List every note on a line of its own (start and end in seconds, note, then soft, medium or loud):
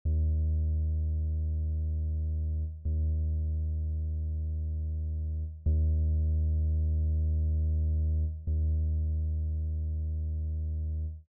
0.05 2.64 D#2 medium
2.85 5.44 D#2 medium
5.66 8.25 D#2 medium
8.47 11.06 D#2 medium